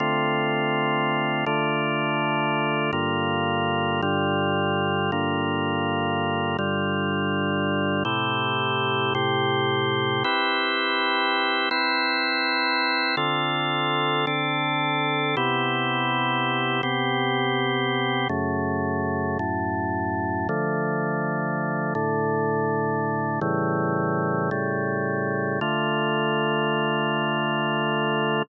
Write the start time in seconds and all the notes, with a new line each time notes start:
0.00 D3 A3 C4 F4
1.46 D3 A3 D4 F4
2.93 G2 D3 A#3 F4
4.02 G2 D3 G3 F4
5.12 G2 D3 A#3 F4
6.59 G2 D3 G3 F4
8.05 A2 C3 E4 G4
9.15 A2 C3 C4 G4
10.24 C4 E4 G4 B4
11.71 C4 E4 B4 C5
13.17 D3 C4 F4 A4
14.27 D3 C4 D4 A4
15.37 C3 B3 E4 G4
16.83 C3 B3 C4 G4
18.29 F#2 C#3 A3
19.39 F#2 A2 A3
20.49 D3 F3 A3
21.95 A2 D3 A3
23.41 A2 C#3 E3 G3
24.51 A2 C#3 G3 A3
25.61 D3 A3 F4